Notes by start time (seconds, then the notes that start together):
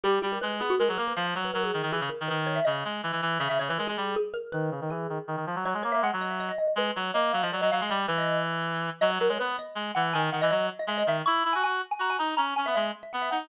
0.03 G3 G4
0.22 G3 G4
0.32 A#4
0.41 G#3 B4
0.60 B3 G#4
0.70 F#4
0.79 G#3 A#4
0.88 F#3 G#4
0.98 A#3 A#4
1.08 B4
1.16 F3 F5
1.27 F5
1.35 F#3 C#5
1.45 B4
1.54 F#3 A#4
1.64 G#4
1.74 D#3
1.83 D#3
1.92 E3 G#4
2.01 C#3
2.09 A#4
2.20 D#3
2.28 D#3 B4
2.47 C#5
2.56 E5
2.65 C#3 D#5
2.85 G#3
3.03 E3
3.12 E3
3.22 E3
3.39 C#3 E5
3.49 C#3 E5
3.59 C#3 C#5
3.69 E3 B4
3.78 G#3 A#4
3.87 G#3 G#4
3.97 G3
4.16 G#4
4.34 A#4
4.52 D#3 B4
4.71 C#3
4.81 D#3
4.90 E3 G#4
5.09 D#3
5.27 D#3
5.36 D#3
5.46 F3
5.56 F#3
5.65 F#3 C#5
5.74 G#3
5.83 A#3 C#5
5.92 A#3 E5
6.02 G#3 F#5
6.13 F#3
6.21 D#5
6.31 E5
6.40 D#5
6.49 D#5
6.58 D#5
6.67 D#5
6.76 G#3 B4
6.96 F#3 C#5
7.14 A#3 D#5
7.33 F#3 F5
7.42 F3 D#5
7.52 F#3 D5
7.61 F#3 D#5
7.71 F#3 F5
7.81 G#3 F5
7.90 G3 D#5
8.07 E3 B4
8.18 D#5
9.01 F#3 D#5
9.10 C#5
9.20 F#3 A#4
9.29 G#3 C#5
9.39 B3 B4
9.59 D#5
9.75 G#3
9.95 E3 F#5
10.13 D#3 G#5
10.32 D#3 F#5
10.41 E3 D#5
10.50 F#3 D#5
10.79 D#5
10.87 G#3 E5
10.98 D#5
11.07 D#3 E5
11.26 E4 C#6
11.44 E4 B5
11.53 F#4 G#5
11.63 F#4 G#5
11.91 G#5
11.99 F#4 A#5
12.10 G#5
12.19 D#4 A#5
12.37 C#4 A#5
12.56 C#4 G#5
12.66 B3 E5
12.75 G#3 E5
13.03 E5
13.13 B3 F#5
13.22 E5
13.31 D#4 F#5